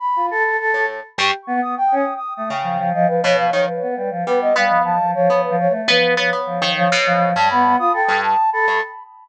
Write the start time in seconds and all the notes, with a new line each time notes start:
0.00 B5
0.16 F4
0.31 A4
0.43 A4
0.59 A4
0.74 A2
0.87 A4
1.18 G2 G4 C#6
1.47 B3
1.62 B3 D#6
1.77 G5
1.92 C#4
1.96 D#6
2.16 D#6
2.35 A3 D#6
2.50 C#3 G5
2.63 F3
2.79 F3
2.93 F3 D#5
3.08 F3 B4
3.23 B2 C#5
3.38 F3 F5
3.52 D#3 F3 C#5
3.68 B4
3.82 B3
3.96 G3 B4
4.11 F3
4.26 G3 B3 B4
4.42 D#5
4.56 G3 B3 F5
4.69 F3
4.85 F3 A5
5.00 F3
5.15 F3 C#5
5.29 F3 B3
5.44 B4
5.50 F3
5.60 C#5
5.69 A3
5.88 F3 B3 B4
6.17 F3 B3 C#5
6.33 B3
6.46 F3
6.62 D#3
6.77 F3 C#5
6.92 B2
7.07 F3
7.35 G2 G3 A5
7.50 B3 B5
7.79 F4 D#6
7.93 A4 G5
8.08 G2
8.24 A5
8.52 A4 B5
8.67 G2 A4